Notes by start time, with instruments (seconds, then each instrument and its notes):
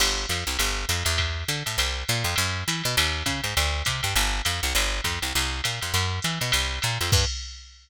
0.00 electric bass (finger) G1, crash, ride
0.29 electric bass (finger) F2, hi-hat pedal, ride
0.47 electric bass (finger) C2, ride
0.59 electric bass (finger) G1, ride
0.89 electric bass (finger) F2, hi-hat pedal, ride
1.05 electric bass (finger) E2, ride
1.18 kick, ride
1.48 electric bass (finger) D3, hi-hat pedal, ride
1.66 electric bass (finger) A2, ride
1.78 electric bass (finger) C2, ride
2.08 electric bass (finger) A#2, hi-hat pedal, ride
2.24 electric bass (finger) F2, ride
2.36 electric bass (finger) F#2, ride
2.68 electric bass (finger) E3, hi-hat pedal, ride
2.84 electric bass (finger) B2, ride
2.97 electric bass (finger) D#2, ride
3.26 electric bass (finger) C#3, kick, hi-hat pedal, ride
3.44 electric bass (finger) G#2, ride
3.57 electric bass (finger) D2, ride
3.85 electric bass (finger) C3, kick, hi-hat pedal, ride
4.03 electric bass (finger) G2, ride
4.16 electric bass (finger) G1, ride
4.45 electric bass (finger) F2, hi-hat pedal, ride
4.63 electric bass (finger) C2, ride
4.75 electric bass (finger) G1, ride
5.04 electric bass (finger) F2, kick, hi-hat pedal, ride
5.22 electric bass (finger) C2, ride
5.35 electric bass (finger) C2, ride
5.64 electric bass (finger) A#2, hi-hat pedal, ride
5.81 electric bass (finger) F2, ride
5.94 electric bass (finger) F#2, ride
6.22 electric bass (finger) E3, hi-hat pedal, ride
6.41 electric bass (finger) B2, ride
6.52 electric bass (finger) C2, ride
6.82 electric bass (finger) A#2, hi-hat pedal, ride
7.01 electric bass (finger) F2, ride
7.12 electric bass (finger) G2, kick, crash